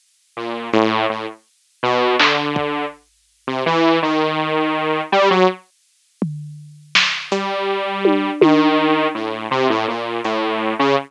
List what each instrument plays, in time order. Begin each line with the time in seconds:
0.37 lead 2 (sawtooth) A#2
0.73 lead 2 (sawtooth) A2, closed hi-hat
1.10 lead 2 (sawtooth) A2
1.83 lead 2 (sawtooth) B2
2.19 lead 2 (sawtooth) D3, clap
2.56 kick
3.47 lead 2 (sawtooth) C3
3.66 lead 2 (sawtooth) E3
4.02 lead 2 (sawtooth) D#3
5.12 lead 2 (sawtooth) G3
5.30 lead 2 (sawtooth) F#3
6.22 floor tom
6.95 snare
7.32 lead 2 (sawtooth) G3, closed hi-hat
8.05 high tom
8.41 lead 2 (sawtooth) D#3, high tom
9.15 lead 2 (sawtooth) A2
9.51 lead 2 (sawtooth) C3
9.70 lead 2 (sawtooth) A2
9.88 lead 2 (sawtooth) A#2
10.24 lead 2 (sawtooth) A2, closed hi-hat
10.79 lead 2 (sawtooth) C#3